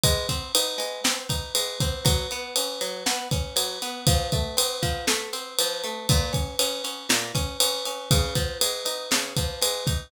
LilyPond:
<<
  \new Staff \with { instrumentName = "Acoustic Guitar (steel)" } { \time 4/4 \key bes \minor \tempo 4 = 119 aes8 c'8 ees'8 aes8 c'8 ees'8 aes8 c'8 | ges8 ces'8 des'8 ges8 ces'8 des'8 ges8 ces'8 | f8 a8 c'8 f8 a8 c'8 f8 a8 | bes,8 des'8 des'8 des'8 bes,8 des'8 des'8 des'8 |
des8 f8 aes8 ees'8 des8 f8 aes8 ees'8 | }
  \new DrumStaff \with { instrumentName = "Drums" } \drummode { \time 4/4 <bd cymr>8 <bd cymr>8 cymr8 cymr8 sn8 <bd cymr>8 cymr8 <bd cymr>8 | <bd cymr>8 cymr8 cymr8 cymr8 sn8 <bd cymr>8 cymr8 cymr8 | <bd cymr>8 <bd cymr>8 cymr8 <bd cymr>8 sn8 cymr8 cymr8 cymr8 | <bd cymr>8 <bd cymr>8 cymr8 cymr8 sn8 <bd cymr>8 cymr8 cymr8 |
<bd cymr>8 <bd cymr>8 cymr8 cymr8 sn8 <bd cymr>8 cymr8 <bd cymr>8 | }
>>